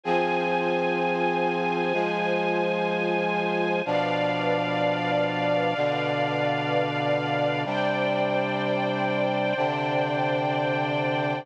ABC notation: X:1
M:4/4
L:1/8
Q:1/4=63
K:C
V:1 name="Brass Section"
[F,C_A]4 [F,_A,A]4 | [B,,F,D]4 [B,,D,D]4 | [C,G,D]4 [C,D,D]4 |]
V:2 name="String Ensemble 1"
[Fc_a]8 | [Bdf]8 | [cdg]8 |]